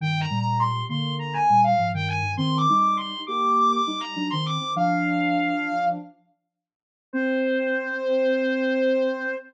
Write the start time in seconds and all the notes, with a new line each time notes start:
0.01 G2 D#3 G5
0.20 A#5
0.30 A#2 G3
0.39 A#5
0.59 C6
0.89 D3 A#3 C6
1.19 A#5
1.33 G#5
1.50 A#2 G3
1.64 F5
1.78 G#2 F3
1.93 G2 D#3 G5
2.07 G#5
2.22 G2 D#3
2.37 D#3 C4 C6
2.57 D6
2.69 G3 D#4
2.76 D6
2.97 C6
3.27 A#3 G4 D6
3.57 D6
3.71 D6
3.87 G3 D#4
4.00 A#5
4.16 F#3 D4
4.30 D#3 C4 C6
4.46 D6
4.60 D#3 C4
4.76 F3 D4 F5
7.13 C4 C5